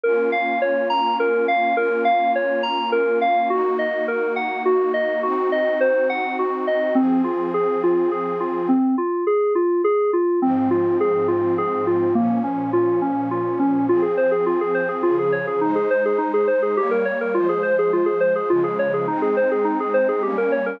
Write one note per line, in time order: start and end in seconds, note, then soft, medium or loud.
0.03 1.75 A#3 medium
0.03 1.75 C#4 medium
0.03 1.75 F4 medium
0.03 0.30 A#4 medium
0.32 0.59 F5 medium
0.62 0.88 C#5 medium
0.90 1.16 A#5 medium
1.20 1.46 A#4 medium
1.48 1.75 F5 medium
1.77 3.48 A#3 medium
1.77 3.48 C#4 medium
1.77 3.48 F4 medium
1.77 2.03 A#4 medium
2.05 2.31 F5 medium
2.35 2.62 C#5 medium
2.63 2.90 A#5 medium
2.92 3.19 A#4 medium
3.21 3.48 F5 medium
3.50 5.22 A#3 loud
3.50 5.22 D#4 medium
3.50 3.76 F#4 medium
3.50 5.22 F#4 loud
3.79 4.05 D#5 medium
4.08 4.34 A#4 medium
4.36 4.62 F#5 medium
4.65 4.92 F#4 medium
4.94 5.20 D#5 medium
5.23 6.94 C4 loud
5.23 6.94 D#4 medium
5.23 5.49 F#4 medium
5.23 6.94 F#4 loud
5.52 5.78 D#5 medium
5.81 6.07 C5 medium
6.09 6.36 F#5 medium
6.39 6.66 F#4 medium
6.67 6.94 D#5 medium
6.95 8.67 F3 medium
6.95 7.22 C4 medium
6.95 8.67 C4 loud
6.95 8.67 G#4 medium
7.24 7.51 F4 medium
7.54 7.81 G#4 medium
7.83 8.10 F4 medium
8.11 8.38 G#4 medium
8.40 8.67 F4 medium
8.69 8.95 C4 medium
8.98 9.24 F4 medium
9.27 9.53 G#4 medium
9.55 9.82 F4 medium
9.84 10.11 G#4 medium
10.13 10.40 F4 medium
10.42 12.13 G#2 loud
10.42 12.13 F3 loud
10.42 12.13 C4 loud
10.42 10.69 C4 medium
10.71 10.97 F4 medium
11.00 11.27 G#4 medium
11.28 11.55 F4 medium
11.58 11.85 G#4 medium
11.87 12.13 F4 medium
12.15 13.87 A#2 medium
12.15 13.87 F3 medium
12.15 12.41 A#3 medium
12.15 13.87 C#4 medium
12.44 12.70 C#4 medium
12.73 13.00 F4 medium
13.02 13.28 C#4 medium
13.31 13.58 F4 medium
13.59 13.86 C#4 medium
13.89 15.03 F3 medium
13.89 15.03 C4 loud
13.89 14.02 F4 medium
13.89 15.03 G#4 medium
14.02 14.15 G#4 medium
14.17 14.31 C5 medium
14.31 14.45 G#4 medium
14.46 14.59 F4 medium
14.61 14.74 G#4 medium
14.75 14.88 C5 medium
14.89 15.02 G#4 medium
15.03 15.61 C#3 medium
15.03 15.61 F3 loud
15.03 15.16 F4 medium
15.03 15.61 G#4 medium
15.19 15.32 G#4 medium
15.32 15.46 C#5 medium
15.47 15.60 G#4 medium
15.61 16.76 G#3 medium
15.61 15.75 D#4 medium
15.61 16.76 D#4 loud
15.61 16.76 C5 medium
15.75 15.89 G#4 medium
15.90 16.04 C5 medium
16.05 16.19 G#4 medium
16.18 16.31 D#4 medium
16.34 16.47 G#4 medium
16.47 16.61 C5 medium
16.62 16.76 G#4 medium
16.77 17.34 G3 medium
16.77 17.34 A#3 loud
16.77 16.90 G4 medium
16.77 17.34 C#5 medium
16.91 17.04 A#4 medium
17.05 17.19 C#5 medium
17.21 17.34 A#4 medium
17.34 18.49 F3 medium
17.34 18.49 G#3 medium
17.34 17.48 F4 medium
17.34 18.50 C5 loud
17.49 17.62 G#4 medium
17.63 17.76 C5 medium
17.79 17.92 G#4 medium
17.93 18.06 F4 medium
18.06 18.19 G#4 medium
18.20 18.34 C5 medium
18.35 18.49 G#4 medium
18.50 19.07 C#3 loud
18.50 19.07 F3 loud
18.50 19.07 G#3 loud
18.50 18.63 F4 medium
18.64 18.77 G#4 medium
18.79 18.92 C#5 medium
18.94 19.07 G#4 medium
19.08 20.23 G#3 loud
19.08 20.23 C4 loud
19.08 19.21 D#4 medium
19.08 20.23 D#4 medium
19.22 19.35 G#4 medium
19.37 19.50 C5 medium
19.51 19.65 G#4 medium
19.65 19.78 D#4 medium
19.80 19.93 G#4 medium
19.94 20.07 C5 medium
20.09 20.22 G#4 medium
20.22 20.80 G3 medium
20.22 20.80 A#3 medium
20.22 20.80 C#4 loud
20.22 20.36 G4 medium
20.38 20.51 A#4 medium
20.52 20.65 C#5 medium
20.66 20.79 A#4 medium